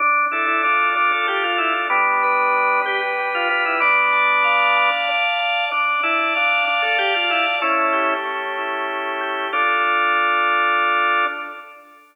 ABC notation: X:1
M:6/8
L:1/16
Q:3/8=63
K:Ddor
V:1 name="Drawbar Organ"
D2 E E D2 D A G F E z | [B,D]6 G z2 F F E | [B,D]8 z4 | D2 E E D2 D A G F E z |
[^CE]4 z8 | D12 |]
V:2 name="Drawbar Organ"
D2 A2 F2 A2 D2 A2 | G,2 B2 D2 B2 G,2 B2 | d2 a2 f2 a2 d2 a2 | d2 a2 f2 a2 d2 a2 |
A,2 G2 ^C2 E2 A,2 G2 | [FA]12 |]